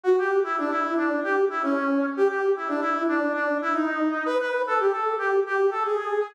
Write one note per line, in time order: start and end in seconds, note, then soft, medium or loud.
0.04 0.16 F#4 medium
0.18 0.40 G4 medium
0.44 0.56 E4 medium
0.58 0.71 D4 medium
0.70 0.94 E4 medium
0.97 1.20 D4 medium
1.23 1.45 G4 medium
1.50 1.62 E4 medium
1.62 2.06 C#4 medium
2.17 2.28 G4 loud
2.28 2.52 G4 medium
2.56 2.69 E4 medium
2.68 2.80 D4 medium
2.81 3.03 E4 medium
3.08 3.33 D4 medium
3.33 3.57 D4 medium
3.62 3.74 E4 medium
3.73 4.24 D#4 medium
4.25 4.38 B4 loud
4.40 4.62 B4 medium
4.67 4.79 A4 medium
4.80 4.92 G4 medium
4.91 5.15 A4 medium
5.18 5.40 G4 medium
5.46 5.70 G4 medium
5.71 5.83 A4 medium
5.84 6.31 G#4 medium